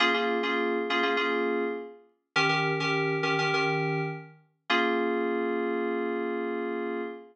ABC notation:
X:1
M:4/4
L:1/16
Q:1/4=102
K:Bbdor
V:1 name="Electric Piano 2"
[B,DFA] [B,DFA]2 [B,DFA]3 [B,DFA] [B,DFA] [B,DFA]8 | [E,DGB] [E,DGB]2 [E,DGB]3 [E,DGB] [E,DGB] [E,DGB]8 | [B,DFA]16 |]